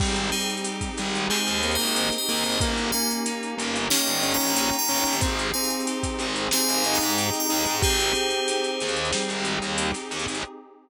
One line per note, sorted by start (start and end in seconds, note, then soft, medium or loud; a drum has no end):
0.00 0.30 G#1 medium
0.00 0.29 G3 loud
0.00 1.30 C4 medium
0.00 2.59 C4 medium
0.00 2.59 D#4 medium
0.00 2.59 G4 medium
0.00 2.59 G#4 medium
0.00 kick loud
0.00 crash loud
0.16 closed hi-hat medium
0.32 0.90 G3 medium
0.32 1.62 D#4 medium
0.32 0.47 G#4 medium
0.32 0.47 C5 medium
0.32 snare soft
0.32 closed hi-hat medium
0.40 closed hi-hat medium
0.50 closed hi-hat medium
0.57 closed hi-hat medium
0.64 1.96 G4 medium
0.64 closed hi-hat loud
0.81 kick medium
0.81 closed hi-hat medium
0.98 1.27 G#1 medium
0.98 1.30 G3 loud
0.98 2.28 G#4 medium
0.98 closed hi-hat medium
1.15 closed hi-hat medium
1.30 1.61 G#3 loud
1.30 2.54 C4 medium
1.30 1.69 G#4 medium
1.30 1.69 C5 medium
1.30 clap loud
1.47 1.76 D#2 medium
1.47 closed hi-hat medium
1.63 2.17 A#3 medium
1.63 2.56 D#4 medium
1.63 closed hi-hat medium
1.71 2.11 C5 medium
1.71 2.11 D#5 medium
1.71 closed hi-hat medium
1.79 2.09 G#1 medium
1.79 closed hi-hat medium
1.87 closed hi-hat medium
1.96 2.58 G4 medium
1.96 closed hi-hat loud
2.12 snare medium
2.12 closed hi-hat medium
2.18 2.60 C5 medium
2.18 2.60 D#5 medium
2.28 2.43 D#2 medium
2.28 2.57 A#3 medium
2.28 2.59 G#4 medium
2.28 closed hi-hat medium
2.37 closed hi-hat medium
2.44 2.59 G#1 medium
2.44 closed hi-hat medium
2.52 closed hi-hat medium
2.61 2.90 G1 medium
2.61 3.90 A#3 medium
2.61 2.91 A#3 loud
2.61 5.20 A#3 medium
2.61 5.20 C#4 medium
2.61 5.20 D#4 medium
2.61 5.20 G4 medium
2.61 kick loud
2.61 closed hi-hat loud
2.77 closed hi-hat medium
2.92 3.55 A#3 loud
2.92 4.24 C#4 medium
2.92 3.08 F5 medium
2.92 3.08 G#5 medium
2.92 closed hi-hat medium
3.11 closed hi-hat medium
3.26 4.57 D#4 medium
3.26 closed hi-hat loud
3.43 closed hi-hat medium
3.58 3.88 G1 medium
3.58 3.88 A#3 loud
3.58 4.89 G4 medium
3.58 closed hi-hat loud
3.76 closed hi-hat medium
3.90 5.14 A#3 medium
3.90 4.23 C#4 medium
3.90 4.29 D#5 medium
3.90 4.29 G5 medium
3.90 snare loud
4.07 4.36 G1 medium
4.07 closed hi-hat medium
4.23 4.76 C#4 loud
4.23 5.17 C#4 medium
4.23 closed hi-hat medium
4.31 4.74 G5 medium
4.31 4.74 A#5 medium
4.31 closed hi-hat medium
4.40 4.69 A#1 medium
4.40 closed hi-hat medium
4.47 closed hi-hat medium
4.56 5.19 D#4 medium
4.56 closed hi-hat loud
4.73 snare medium
4.73 closed hi-hat medium
4.79 5.15 G5 medium
4.79 5.15 A#5 medium
4.88 5.03 G1 medium
4.88 5.16 C#4 loud
4.88 5.21 G4 medium
4.88 closed hi-hat medium
4.97 closed hi-hat medium
5.05 5.21 G1 medium
5.05 closed hi-hat medium
5.13 closed hi-hat medium
5.21 5.51 G#1 medium
5.21 5.47 C4 loud
5.21 6.52 C4 medium
5.21 7.80 C4 medium
5.21 7.80 D#4 medium
5.21 7.80 G4 medium
5.21 7.80 G#4 medium
5.21 kick loud
5.21 closed hi-hat loud
5.39 closed hi-hat medium
5.54 6.19 C4 loud
5.54 6.84 D#4 medium
5.54 5.69 F5 medium
5.54 5.69 G#5 medium
5.54 closed hi-hat medium
5.64 closed hi-hat medium
5.70 closed hi-hat medium
5.80 closed hi-hat medium
5.87 7.16 G4 medium
5.87 closed hi-hat loud
6.03 kick loud
6.03 snare soft
6.03 closed hi-hat loud
6.19 6.48 G#1 medium
6.19 6.51 C4 medium
6.19 7.50 G#4 medium
6.19 closed hi-hat medium
6.36 closed hi-hat medium
6.51 7.77 C4 medium
6.51 6.84 C4 loud
6.51 6.95 F5 medium
6.51 6.95 G#5 medium
6.51 snare loud
6.69 6.98 G#1 medium
6.69 closed hi-hat medium
6.84 7.77 D#4 medium
6.84 7.46 D#4 medium
6.84 closed hi-hat medium
6.94 7.34 G5 medium
6.94 7.34 A#5 medium
6.94 closed hi-hat medium
7.00 7.30 G#2 medium
7.00 closed hi-hat medium
7.10 closed hi-hat medium
7.17 7.79 G4 medium
7.17 closed hi-hat loud
7.33 snare medium
7.33 closed hi-hat medium
7.40 7.77 G5 medium
7.40 7.77 A#5 medium
7.49 7.65 D#2 medium
7.49 7.76 D#4 loud
7.49 7.81 G#4 medium
7.49 closed hi-hat medium
7.66 7.81 G#2 medium
7.66 closed hi-hat medium
7.82 8.12 G#1 medium
7.82 9.13 C4 medium
7.82 10.41 C4 medium
7.82 10.41 D#4 medium
7.82 8.71 G4 loud
7.82 10.41 G4 medium
7.82 10.41 G#4 medium
7.82 9.23 G#4 medium
7.82 9.23 C5 medium
7.82 kick loud
7.82 closed hi-hat loud
8.00 closed hi-hat medium
8.15 9.45 D#4 medium
8.15 closed hi-hat medium
8.30 closed hi-hat medium
8.48 9.78 G4 medium
8.48 closed hi-hat loud
8.64 closed hi-hat medium
8.80 9.11 D#2 medium
8.80 10.10 G#4 medium
8.80 closed hi-hat medium
8.88 closed hi-hat medium
8.96 closed hi-hat medium
9.05 closed hi-hat medium
9.13 9.94 G3 medium
9.13 10.37 C4 medium
9.13 snare loud
9.29 9.58 G#1 medium
9.29 closed hi-hat medium
9.45 10.39 D#4 medium
9.45 closed hi-hat medium
9.62 9.91 D#2 medium
9.62 closed hi-hat medium
9.78 10.40 G4 medium
9.78 closed hi-hat loud
9.94 snare medium
9.94 closed hi-hat medium
10.11 10.26 D#2 medium
10.11 10.42 G#4 medium
10.11 closed hi-hat medium
10.19 closed hi-hat medium
10.28 10.43 G#1 medium
10.28 closed hi-hat medium
10.35 closed hi-hat medium